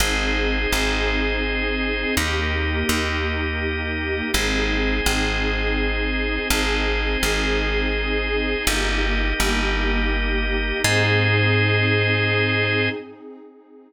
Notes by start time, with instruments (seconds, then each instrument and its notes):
0.00 electric bass (finger) G#1, pad 2 (warm) C4 D#4 G#4, drawbar organ G#4 C5 D#5
0.72 electric bass (finger) G#1
2.17 electric bass (finger) D#2, pad 2 (warm) A#3 D#4 G4, drawbar organ G4 A#4 D#5
2.89 electric bass (finger) D#2
4.34 electric bass (finger) G#1, pad 2 (warm) C4 D#4 G#4, drawbar organ G#4 C5 D#5
5.06 electric bass (finger) G#1
6.50 electric bass (finger) G#1, pad 2 (warm) C4 D#4 G#4, drawbar organ G#4 C5 D#5
7.23 electric bass (finger) G#1
8.67 electric bass (finger) G1, pad 2 (warm) A#3 D#4 G4, drawbar organ G4 A#4 D#5
9.40 electric bass (finger) G1
10.84 electric bass (finger) G#2, pad 2 (warm) C4 D#4 G#4, drawbar organ G#4 C5 D#5